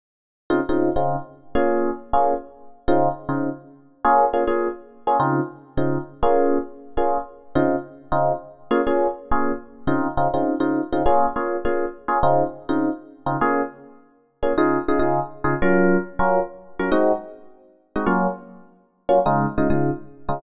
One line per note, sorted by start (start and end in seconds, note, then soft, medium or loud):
0.50 0.60 C#3 loud
0.50 0.60 C4 loud
0.50 0.60 D#4 loud
0.50 0.60 F4 loud
0.69 0.89 C#3 loud
0.69 0.89 C4 medium
0.69 0.89 D#4 medium
0.69 0.89 F4 loud
0.96 1.16 C#3 medium
0.96 1.16 C4 medium
0.96 1.16 D#4 medium
0.96 1.16 F4 medium
1.55 1.90 A#3 loud
1.55 1.90 C#4 loud
1.55 1.90 F4 loud
1.55 1.90 G#4 loud
2.13 2.34 A#3 medium
2.13 2.34 C#4 loud
2.13 2.34 F4 medium
2.13 2.34 G#4 medium
2.88 3.08 C#3 loud
2.88 3.08 C4 loud
2.88 3.08 D#4 loud
2.88 3.08 F4 loud
3.29 3.49 C#3 loud
3.29 3.49 C4 medium
3.29 3.49 D#4 medium
3.29 3.49 F4 medium
4.05 4.25 A#3 loud
4.05 4.25 C#4 loud
4.05 4.25 F4 loud
4.05 4.25 G#4 loud
4.33 4.44 A#3 medium
4.33 4.44 C#4 medium
4.33 4.44 F4 medium
4.33 4.44 G#4 medium
4.47 4.68 A#3 medium
4.47 4.68 C#4 medium
4.47 4.68 F4 medium
4.47 4.68 G#4 loud
5.07 5.17 A#3 medium
5.07 5.17 C#4 loud
5.07 5.17 F4 medium
5.07 5.17 G#4 medium
5.20 5.40 C#3 loud
5.20 5.40 C4 loud
5.20 5.40 D#4 loud
5.20 5.40 F4 loud
5.77 5.98 C#3 medium
5.77 5.98 C4 medium
5.77 5.98 D#4 medium
5.77 5.98 F4 medium
6.23 6.58 A#3 loud
6.23 6.58 C#4 loud
6.23 6.58 F4 loud
6.23 6.58 G#4 loud
6.97 7.18 A#3 medium
6.97 7.18 C#4 medium
6.97 7.18 F4 loud
6.97 7.18 G#4 medium
7.55 7.76 C#3 loud
7.55 7.76 C4 loud
7.55 7.76 D#4 loud
7.55 7.76 F4 loud
8.12 8.32 C#3 medium
8.12 8.32 C4 medium
8.12 8.32 D#4 loud
8.12 8.32 F4 loud
8.71 8.81 A#3 loud
8.71 8.81 C#4 loud
8.71 8.81 F4 loud
8.71 8.81 G#4 loud
8.87 9.07 A#3 medium
8.87 9.07 C#4 loud
8.87 9.07 F4 medium
8.87 9.07 G#4 medium
9.31 9.52 A#3 medium
9.31 9.52 C#4 loud
9.31 9.52 F4 medium
9.31 9.52 G#4 medium
9.87 10.08 C#3 loud
9.87 10.08 C4 loud
9.87 10.08 D#4 loud
9.87 10.08 F4 loud
10.17 10.28 C#3 medium
10.17 10.28 C4 medium
10.17 10.28 D#4 medium
10.17 10.28 F4 loud
10.34 10.54 C#3 loud
10.34 10.54 C4 medium
10.34 10.54 D#4 medium
10.34 10.54 F4 medium
10.60 10.81 C#3 medium
10.60 10.81 C4 medium
10.60 10.81 D#4 medium
10.60 10.81 F4 loud
10.92 11.03 C#3 medium
10.92 11.03 C4 medium
10.92 11.03 D#4 medium
10.92 11.03 F4 loud
11.06 11.26 A#3 loud
11.06 11.26 C#4 loud
11.06 11.26 F4 loud
11.06 11.26 G#4 loud
11.36 11.56 A#3 medium
11.36 11.56 C#4 loud
11.36 11.56 F4 medium
11.36 11.56 G#4 medium
11.65 11.85 A#3 medium
11.65 11.85 C#4 medium
11.65 11.85 F4 loud
11.65 11.85 G#4 medium
12.08 12.18 A#3 medium
12.08 12.18 C#4 medium
12.08 12.18 F4 loud
12.08 12.18 G#4 loud
12.23 12.43 C#3 loud
12.23 12.43 C4 loud
12.23 12.43 D#4 loud
12.23 12.43 F4 loud
12.69 12.89 C#3 medium
12.69 12.89 C4 medium
12.69 12.89 D#4 loud
12.69 12.89 F4 medium
13.26 13.37 C#3 medium
13.26 13.37 C4 medium
13.26 13.37 D#4 medium
13.26 13.37 F4 medium
13.41 13.62 A#3 loud
13.41 13.62 C#4 loud
13.41 13.62 F4 loud
13.41 13.62 G#4 loud
14.43 14.53 A#3 medium
14.43 14.53 C#4 loud
14.43 14.53 F4 medium
14.43 14.53 G#4 loud
14.58 14.78 C#3 loud
14.58 14.78 D#4 loud
14.58 14.78 F4 loud
14.58 14.78 G#4 loud
14.88 14.99 C#3 medium
14.88 14.99 D#4 medium
14.88 14.99 F4 medium
14.88 14.99 G#4 loud
14.99 15.20 C#3 medium
14.99 15.20 D#4 medium
14.99 15.20 F4 loud
14.99 15.20 G#4 medium
15.44 15.54 C#3 loud
15.44 15.54 D#4 loud
15.44 15.54 F4 loud
15.44 15.54 G#4 loud
15.62 15.97 F#3 loud
15.62 15.97 C#4 loud
15.62 15.97 F4 loud
15.62 15.97 A#4 loud
16.19 16.40 F#3 loud
16.19 16.40 C#4 loud
16.19 16.40 F4 medium
16.19 16.40 A#4 loud
16.79 16.90 F#3 loud
16.79 16.90 C#4 medium
16.79 16.90 F4 medium
16.79 16.90 A#4 loud
16.92 17.12 G#3 loud
16.92 17.12 C4 loud
16.92 17.12 D#4 loud
16.92 17.12 F#4 loud
17.96 18.06 G#3 medium
17.96 18.06 C4 medium
17.96 18.06 D#4 loud
17.96 18.06 F#4 medium
18.06 18.27 F#3 loud
18.06 18.27 A#3 loud
18.06 18.27 C#4 loud
18.06 18.27 F4 loud
19.09 19.19 F#3 loud
19.09 19.19 A#3 medium
19.09 19.19 C#4 loud
19.09 19.19 F4 loud
19.26 19.46 C#3 loud
19.26 19.46 G#3 loud
19.26 19.46 D#4 loud
19.26 19.46 F4 loud
19.58 19.68 C#3 loud
19.58 19.68 G#3 medium
19.58 19.68 D#4 loud
19.58 19.68 F4 medium
19.70 19.90 C#3 loud
19.70 19.90 G#3 loud
19.70 19.90 D#4 medium
19.70 19.90 F4 loud
20.29 20.39 C#3 loud
20.29 20.39 G#3 loud
20.29 20.39 D#4 medium
20.29 20.39 F4 medium